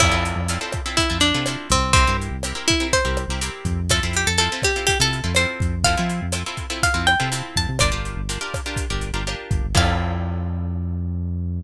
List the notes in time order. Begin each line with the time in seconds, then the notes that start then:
0.00 F2 C4 E4 F4 A4, kick, cross-stick, crash
0.12 F2 C4 E4 F4 A4
0.25 closed hi-hat
0.36 F2
0.48 C4 E4 F4 A4, closed hi-hat
0.61 C4 E4 F4 A4
0.72 kick, cross-stick, closed hi-hat
0.86 C4 E4 F4 A4
0.97 E4, kick, closed hi-hat
1.10 F2 C4 E4 F4 A4
1.20 D4, closed hi-hat
1.34 C3 C4 E4 F4 A4
1.46 C4 E4 F4 A4, cross-stick, closed hi-hat
1.70 C2 C4, kick, closed hi-hat
1.93 C4 E4 G4 A#4, kick, closed hi-hat
2.07 G2 C4 E4 G4 A#4
2.21 closed hi-hat
2.31 C2
2.43 C4 E4 G4 A#4, cross-stick, closed hi-hat
2.55 C4 E4 G4 A#4
2.68 E4, kick, closed hi-hat
2.80 C4 E4 G4 A#4
2.93 C5, kick, closed hi-hat
3.05 C2 C4 E4 G4 A#4
3.17 cross-stick, closed hi-hat
3.28 C2 C4 E4 G4 A#4
3.41 C4 E4 G4 A#4, closed hi-hat
3.65 F2, kick, closed hi-hat
3.89 C4 E4 F4 A4, kick, cross-stick, closed hi-hat
4.03 F2 C4 E4 F4 A4
4.13 G4, closed hi-hat
4.27 F2 A4
4.38 C4 E4 F4 A4, closed hi-hat
4.52 C4 E4 F4 A4
4.62 G4, kick, cross-stick, closed hi-hat
4.76 C4 E4 F4 A4
4.87 G4, kick, closed hi-hat
5.00 C3 C4 E4 F4 A4
5.13 closed hi-hat
5.24 F2 C4 E4 F4 A4
5.35 C4 E4 F4 A4 C5, cross-stick, closed hi-hat
5.60 F2, kick, closed hi-hat
5.84 C4 E4 F4 A4 F5, kick, closed hi-hat
5.97 F3 C4 E4 F4 A4
6.09 closed hi-hat
6.22 F2
6.32 C4 E4 F4 A4, cross-stick, closed hi-hat
6.46 C4 E4 F4 A4
6.57 kick, closed hi-hat
6.70 C4 E4 F4 A4
6.83 F5, kick, closed hi-hat
6.94 F2 C4 E4 F4 A4
7.07 G5, cross-stick, closed hi-hat
7.20 C3 C4 E4 F4 A4
7.32 C4 E4 F4 A4, closed hi-hat
7.56 F2 A5, kick, closed hi-hat
7.69 C3
7.79 G1 D4 F4 G4 A#4 D5, kick, cross-stick, closed hi-hat
7.92 G1 D4 F4 G4 A#4
8.05 closed hi-hat
8.16 G1
8.29 D4 F4 G4 A#4, closed hi-hat
8.41 D4 F4 G4 A#4
8.54 kick, cross-stick, closed hi-hat
8.66 D4 F4 G4 A#4
8.76 kick, closed hi-hat
8.90 G1 D4 F4 G4 A#4
9.01 closed hi-hat
9.13 G1 D4 F4 G4 A#4
9.27 D4 F4 G4 A#4, cross-stick, closed hi-hat
9.51 G1, kick, closed hi-hat
9.64 G1
9.75 F2 C4 E4 F4 A4 F5, kick, crash